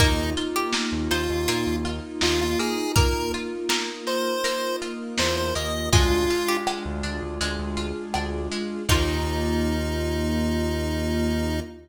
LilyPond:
<<
  \new Staff \with { instrumentName = "Lead 1 (square)" } { \time 4/4 \key ees \major \tempo 4 = 81 ees'8 r4 f'4 r8 f'16 f'16 aes'8 | bes'8 r4 c''4 r8 c''16 c''16 ees''8 | f'4 r2. | ees'1 | }
  \new Staff \with { instrumentName = "Pizzicato Strings" } { \time 4/4 \key ees \major bes'8. g'8. c''8 f'2 | bes'4 bes'2 r4 | aes'8. g'4~ g'16 r2 | ees'1 | }
  \new Staff \with { instrumentName = "Electric Piano 2" } { \time 4/4 \key ees \major <bes ees' f'>1~ | <bes ees' f'>1 | <d' f' aes'>1 | <bes ees' f'>1 | }
  \new Staff \with { instrumentName = "Pizzicato Strings" } { \time 4/4 \key ees \major bes8 f'8 bes8 ees'8 bes8 f'8 ees'8 bes8 | bes8 f'8 bes8 ees'8 bes8 f'8 ees'8 bes8 | aes8 f'8 aes8 d'8 aes8 f'8 d'8 aes8 | <bes ees' f'>1 | }
  \new Staff \with { instrumentName = "Synth Bass 1" } { \clef bass \time 4/4 \key ees \major ees,4~ ees,16 ees,16 ees,16 ees,16 bes,16 ees,8. ees,4~ | ees,2. e,8 ees,8 | d,4~ d,16 d,16 d,16 d,16 d,16 d,8. d,4 | ees,1 | }
  \new Staff \with { instrumentName = "String Ensemble 1" } { \time 4/4 \key ees \major <bes ees' f'>1 | <bes f' bes'>1 | <aes d' f'>2 <aes f' aes'>2 | <bes ees' f'>1 | }
  \new DrumStaff \with { instrumentName = "Drums" } \drummode { \time 4/4 <hh bd>8 hh8 sn8 hh8 hh8 hh8 sn8 hh8 | <hh bd>8 hh8 sn8 hh8 hh8 hh8 sn8 hh8 | <hh bd>8 hh8 ss8 hh8 hh8 hh8 ss8 hh8 | <cymc bd>4 r4 r4 r4 | }
>>